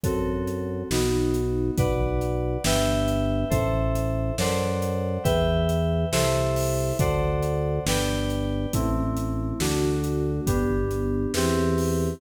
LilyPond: <<
  \new Staff \with { instrumentName = "Electric Piano 2" } { \time 6/8 \key e \minor \tempo 4. = 69 <c' fis' a'>4. <b dis' fis'>4. | \key g \major <b' d'' fis''>4. <b' e'' g''>4. | <a' c'' e''>4. <a' c'' d'' fis''>4. | <b' e'' g''>4. <a' c'' e''>4. |
<a' c'' d'' fis''>4. <b' d'' g''>4. | \key e \minor <a c' e'>4. <a d' fis'>4. | <b d' g'>4. <c' e' g'>4. | }
  \new Staff \with { instrumentName = "Drawbar Organ" } { \clef bass \time 6/8 \key e \minor fis,4. b,,4. | \key g \major b,,4. g,,4. | a,,4. fis,4. | e,4. c,4. |
d,4. g,,4. | \key e \minor a,,4. d,4. | g,,4. e,4. | }
  \new DrumStaff \with { instrumentName = "Drums" } \drummode { \time 6/8 <hh bd>8. hh8. sn8. hh8. | <hh bd>8. hh8. sn8. hh8. | <hh bd>8. hh8. sn8. hh8. | <hh bd>8. hh8. sn8. hho8. |
<hh bd>8. hh8. sn8. hh8. | <hh bd>8. hh8. sn8. hh8. | <hh bd>8. hh8. sn8. hho8. | }
>>